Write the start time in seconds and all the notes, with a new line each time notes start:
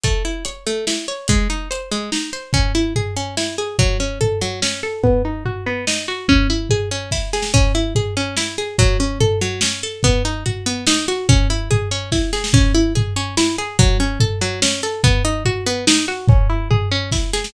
0.03 A3, kick, closed hi-hat
0.25 E4
0.45 C#5, closed hi-hat
0.66 A3
0.87 E4, snare
1.08 C#5
1.28 G#3, kick, closed hi-hat
1.50 D#4
1.71 C5, closed hi-hat
1.91 G#3
2.12 D#4, snare
2.33 C5
2.53 C#4, kick, floor tom
2.75 E4
2.96 G#4, floor tom
3.16 C#4
3.37 E4, snare
3.58 G#4
3.79 F#3, kick, floor tom
4.00 C#4
4.21 A4, floor tom
4.41 F#3
4.62 C#4, snare
4.83 A4
5.03 B3, kick, floor tom
5.25 D#4
5.45 F#4, floor tom
5.66 B3
5.87 D#4, snare
6.08 F#4
6.28 C#4, kick, floor tom
6.50 E4
6.70 G#4, floor tom
6.91 C#4
7.11 E4, kick, snare
7.33 G#4, snare
7.42 snare
7.54 C#4, kick, floor tom
7.75 E4
7.95 G#4, floor tom
8.17 C#4
8.37 E4, snare
8.58 G#4
8.78 F#3, kick, floor tom
9.00 C#4
9.20 A4, floor tom
9.41 F#3
9.61 C#4, snare
9.83 A4
10.03 B3, kick, floor tom
10.25 D#4
10.46 F#4, floor tom
10.66 B3
10.87 D#4, snare
11.08 F#4
11.29 C#4, kick, floor tom
11.50 E4
11.71 G#4, floor tom
11.91 C#4
12.12 E4, kick, snare
12.33 G#4, snare
12.44 snare
12.53 C#4, kick, floor tom
12.75 E4
12.95 G#4, floor tom
13.16 C#4
13.37 E4, snare
13.58 G#4
13.79 F#3, kick, floor tom
14.00 C#4
14.20 A4, floor tom
14.41 F#3
14.62 C#4, snare
14.83 A4
15.04 B3, kick, floor tom
15.25 D#4
15.45 F#4, floor tom
15.66 B3
15.87 D#4, snare
16.08 F#4
16.28 C#4, kick, floor tom
16.50 E4
16.71 G#4, floor tom
16.91 C#4
17.12 E4, kick, snare
17.33 G#4, snare
17.44 snare